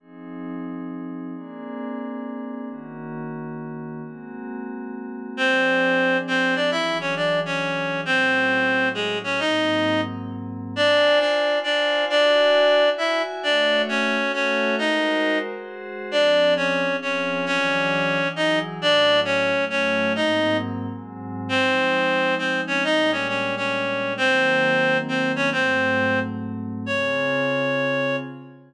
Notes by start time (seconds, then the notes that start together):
0.00 F3 C4 D#4 G#4
1.34 A#3 C4 D4 G#4
2.68 D#3 A#3 C#4 F#4
4.03 G#3 A#3 C4 F#4
5.37 F3 C4 D4 G#4 C5
6.27 C4 C5
6.55 D4 D5
6.71 E3 F#3 D4 E4 G#4 E5
7.01 C#4 C#5
7.16 D4 D5
7.46 C#4 C#5
8.05 A2 F#3 C4 C#4 E4 C5
8.94 G#3 G#4
9.24 C#4 C#5
9.39 G#2 F#3 A#3 C4 D#4 D#5
10.75 D4 F4 C5 D5 G#5
11.19 D4 D5
11.47 F4 C5 F5 G#5
11.64 D4 D5
12.09 D4 E4 F#4 D5 G#5
12.82 E4 F#4 E5 G#5
12.98 E4 E5
13.43 A3 D4 F#4 C#5 D5 E5
13.89 C#4 C#5
14.16 A3 F#4 A4 E5
14.34 C#4 C#5
14.78 G#3 D#4 F#4 A#4 C5 D#5
15.50 G#3 F#4 G#4 C5
16.11 F3 C4 D4 G#4 D5
16.57 C#4 C#5
16.85 F3 C4 F4 G#4
17.02 C#4 C#5
17.46 E3 F#3 C#4 D4 G#4 C#5
18.19 E3 F#3 E4 G#4
18.36 D#4 D#5
18.80 A2 F#3 C#4 D4 E4 D5
19.25 C#4 C#5
19.54 A2 F#3 A3 E4
19.70 C#4 C#5
20.15 G#2 F#3 A#3 C4 D#4 D#5
20.88 G#2 F#3 G#3 C4
21.49 F3 G#3 C4 D#4 C5
22.38 C4 C5
22.67 C#4 C#5
22.83 A#2 G3 G#3 D4 D#4 D#5
23.12 C#4 C#5
23.28 C#4 C#5
23.57 C#4 C#5
24.17 D#3 F#3 A#3 C4 C5
25.08 C4 C5
25.36 C#4 C#5
25.52 G#2 F#3 A3 C4 C5
26.86 C#3 C4 F4 G#4 C#5